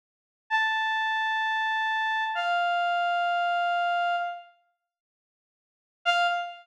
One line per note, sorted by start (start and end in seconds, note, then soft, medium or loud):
0.50 2.24 A5 medium
2.35 4.16 F5 medium
6.05 6.27 F5 loud